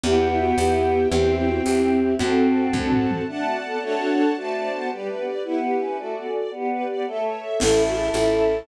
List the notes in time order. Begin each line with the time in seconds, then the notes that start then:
0.03 E2 B3 E4 G4 B4 E5 G5, cowbell, low conga
0.31 E4
0.40 F#4
0.57 E2 B3 E4 G4, tambourine, cowbell, high conga
1.11 E2 C4 E4 G4 C5 E5 G5, cowbell, low conga
1.39 E4
1.48 F#4
1.64 E2 C4 E4 G4, tambourine, cowbell, high conga
2.19 F#2 C4 F#4 A4 C5 F#5 A5, cowbell, low conga
2.73 F#2 C4 D4 F#4 A4, kick, high tom
2.92 floor tom
3.11 mid tom
3.27 A3 D4 D5 F#5 A5
3.47 F#4
3.64 B3 A4
3.81 A3 D4 F#4 A4 C#5 F#5 A5
4.00 A3
4.09 B3
4.36 A3 F#4 C5 D5 A5
4.55 D5
4.72 B3 C5
4.91 G3 G4 B4 D5
5.08 A3 B4
5.18 B3
5.27 D5
5.44 B3 E4 G4 B4
5.63 G4
5.80 C#4 B4
5.98 A3 F#4 A4 D5
6.15 B3 D5
6.27 C#4
6.34 D5
6.51 B3 G4 B4 D5
6.70 B4
6.88 B3 D5
7.07 A3 A4 C#5 E5
7.25 C#5
7.42 E5
7.59 A1 C#4 E4 A4 C#5 E5 A5, crash, cowbell, low conga
7.87 F#4
7.97 G#4
8.14 A1 C#4 E4 A4, tambourine, cowbell, high conga